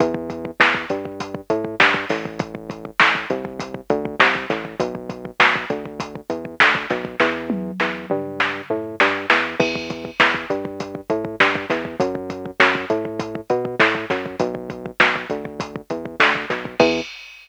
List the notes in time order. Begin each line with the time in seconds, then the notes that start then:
0.00 E2, kick, closed hi-hat
0.14 kick
0.30 kick, closed hi-hat
0.45 kick
0.60 E2, kick, snare
0.74 kick
0.90 G2, kick, closed hi-hat
1.05 kick
1.20 kick, closed hi-hat
1.34 kick
1.50 A2, kick, closed hi-hat
1.65 kick
1.80 G2, kick, snare
1.94 kick
2.10 A1, kick, snare, open hi-hat
2.25 kick
2.39 kick, closed hi-hat
2.55 kick
2.70 kick, closed hi-hat
2.85 kick
3.00 A1, kick, snare
3.15 kick
3.30 C2, kick, closed hi-hat
3.45 kick
3.60 kick, closed hi-hat
3.74 kick
3.90 D2, kick, closed hi-hat
4.05 kick
4.20 C2, kick, snare
4.35 kick
4.50 A1, kick, snare, closed hi-hat
4.65 kick
4.80 B1, kick, closed hi-hat
4.95 kick
5.09 kick, closed hi-hat
5.25 kick
5.40 B1, kick, snare
5.55 kick
5.70 D2, kick, closed hi-hat
5.86 kick
6.00 kick, closed hi-hat
6.15 kick
6.30 E2, kick, closed hi-hat
6.45 kick
6.60 D2, kick, snare
6.75 kick
6.90 B1, kick, snare, closed hi-hat
7.05 kick
7.20 E2, kick, snare
7.50 high tom
7.80 E2, snare
8.10 G2, mid tom
8.40 snare
8.70 A2, floor tom
9.00 G2, snare
9.30 E2, snare
9.60 E2, kick, crash
9.76 kick
9.90 kick, closed hi-hat
10.05 kick
10.20 E2, kick, snare
10.34 kick
10.50 G2, kick, closed hi-hat
10.65 kick
10.80 kick, closed hi-hat
10.95 kick
11.10 A2, kick, closed hi-hat
11.25 kick
11.40 G2, kick, snare
11.55 kick
11.70 E2, kick, snare, closed hi-hat
11.85 kick
12.00 F#2, kick, closed hi-hat
12.15 kick
12.30 kick, closed hi-hat
12.46 kick
12.60 F#2, kick, snare
12.75 kick
12.90 A2, kick, closed hi-hat
13.05 kick
13.20 kick, closed hi-hat
13.35 kick
13.50 B2, kick, closed hi-hat
13.65 kick
13.79 A2, kick, snare
13.95 kick
14.10 F#2, kick, snare, closed hi-hat
14.26 kick
14.40 B1, kick, closed hi-hat
14.55 kick
14.70 kick, closed hi-hat
14.86 kick
15.00 B1, kick, snare
15.16 kick
15.30 D2, kick, closed hi-hat
15.45 kick
15.60 kick, closed hi-hat
15.76 kick
15.90 E2, kick, closed hi-hat
16.05 kick
16.20 D2, kick, snare
16.35 kick
16.50 B1, kick, snare, closed hi-hat
16.65 kick
16.80 E2, kick, crash